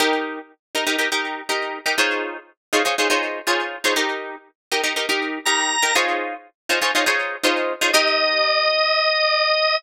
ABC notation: X:1
M:4/4
L:1/16
Q:1/4=121
K:Ebmix
V:1 name="Drawbar Organ"
z16 | z16 | z12 b4 | z16 |
e16 |]
V:2 name="Acoustic Guitar (steel)"
[EGB]6 [EGB] [EGB] [EGB] [EGB]3 [EGB]3 [EGB] | [EFAcd]6 [EFAcd] [EFAcd] [EFAcd] [EFAcd]3 [EFAcd]3 [EFAcd] | [EGB]6 [EGB] [EGB] [EGB] [EGB]3 [EGB]3 [EGB] | [EFAcd]6 [EFAcd] [EFAcd] [EFAcd] [EFAcd]3 [EFAcd]3 [EFAcd] |
[EGB]16 |]